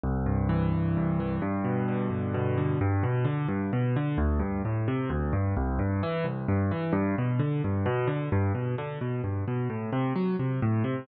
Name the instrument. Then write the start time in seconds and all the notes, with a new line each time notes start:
acoustic grand piano
0.04 C2
0.26 G2
0.49 E3
0.72 C2
0.97 G2
1.20 E3
1.42 G2
1.64 B2
1.88 D3
2.10 G2
2.34 B2
2.58 D3
2.81 G2
3.03 B2
3.25 D3
3.48 G2
3.73 B2
3.96 D3
4.18 D2
4.39 G2
4.65 A2
4.88 C3
5.10 D2
5.33 G2
5.57 C2
5.79 G2
6.03 E3
6.24 C2
6.48 G2
6.71 E3
6.93 G2
7.18 B2
7.39 D3
7.64 G2
7.86 B2
8.07 D3
8.32 G2
8.55 B2
8.78 D3
9.01 B2
9.24 G2
9.48 B2
9.70 A2
9.93 C3
10.16 F#3
10.39 C3
10.62 A2
10.84 C3